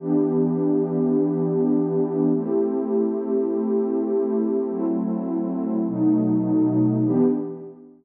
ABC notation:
X:1
M:4/4
L:1/8
Q:1/4=102
K:Em
V:1 name="Pad 2 (warm)"
[E,B,DG]8 | [A,CEG]8 | [F,A,CE]4 [B,,F,A,^D]4 | [E,B,DG]2 z6 |]